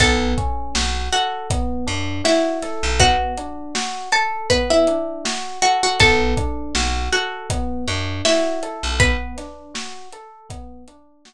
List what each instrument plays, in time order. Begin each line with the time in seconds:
0.00 electric bass (finger) B1, electric piano 1 B3, pizzicato strings A4 A5, kick, closed hi-hat
0.38 electric piano 1 C#4, kick, closed hi-hat
0.75 electric bass (finger) B1, electric piano 1 F#4, snare
1.12 pizzicato strings F#4 F#5, electric piano 1 A4, closed hi-hat
1.50 electric piano 1 B3, kick, closed hi-hat
1.87 electric bass (finger) F#2, electric piano 1 D4, closed hi-hat
2.24 pizzicato strings E4 E5, electric piano 1 F#4, snare
2.62 electric piano 1 A4, snare, closed hi-hat
2.83 electric bass (finger) B1
2.99 electric piano 1 B3, pizzicato strings F#4 F#5, kick, closed hi-hat
3.38 electric piano 1 D4, closed hi-hat
3.75 electric piano 1 F#4, snare
4.12 pizzicato strings A4 A5, electric piano 1 A4, closed hi-hat
4.50 electric piano 1 B3, pizzicato strings B4 B5, kick, closed hi-hat
4.70 pizzicato strings E4 E5
4.87 electric piano 1 D4, closed hi-hat
5.25 electric piano 1 F#4, snare
5.62 pizzicato strings F#4 F#5, electric piano 1 A4, closed hi-hat
5.83 pizzicato strings F#4 F#5
6.00 electric bass (finger) B1, electric piano 1 B3, pizzicato strings A4 A5, kick, closed hi-hat
6.37 electric piano 1 D4, kick, closed hi-hat
6.75 electric bass (finger) B1, electric piano 1 F#4, snare
7.12 pizzicato strings F#4 F#5, electric piano 1 A4, closed hi-hat
7.50 electric piano 1 B3, kick, closed hi-hat
7.88 electric bass (finger) F#2, electric piano 1 D4, closed hi-hat
8.25 pizzicato strings E4 E5, electric piano 1 F#4, snare
8.63 electric piano 1 A4, closed hi-hat
8.83 electric bass (finger) B1
9.00 electric piano 1 B3, pizzicato strings B4 B5, kick, closed hi-hat
9.38 electric piano 1 D4, snare, closed hi-hat
9.74 electric piano 1 F#4, snare
10.12 electric piano 1 A4, closed hi-hat
10.49 electric piano 1 B3, kick, closed hi-hat
10.88 electric piano 1 D4, closed hi-hat
11.25 electric piano 1 F#4, snare